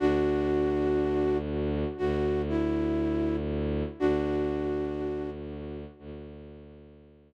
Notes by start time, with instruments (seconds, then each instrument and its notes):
0.00 violin D2, flute D4 F#4
1.98 violin D2, flute F#4
2.49 flute E4
4.00 violin D2, flute D4 F#4
5.99 violin D2